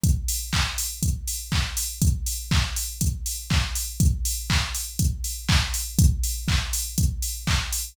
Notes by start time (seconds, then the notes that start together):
0.04 kick, closed hi-hat
0.28 open hi-hat
0.53 kick, clap
0.78 open hi-hat
1.03 kick, closed hi-hat
1.27 open hi-hat
1.52 kick, clap
1.77 open hi-hat
2.02 kick, closed hi-hat
2.26 open hi-hat
2.51 kick, clap
2.76 open hi-hat
3.01 kick, closed hi-hat
3.26 open hi-hat
3.50 kick, clap
3.75 open hi-hat
4.00 kick, closed hi-hat
4.25 open hi-hat
4.50 kick, clap
4.75 open hi-hat
4.99 kick, closed hi-hat
5.24 open hi-hat
5.49 kick, clap
5.74 open hi-hat
5.99 kick, closed hi-hat
6.23 open hi-hat
6.48 kick, clap
6.73 open hi-hat
6.98 kick, closed hi-hat
7.22 open hi-hat
7.47 kick, clap
7.73 open hi-hat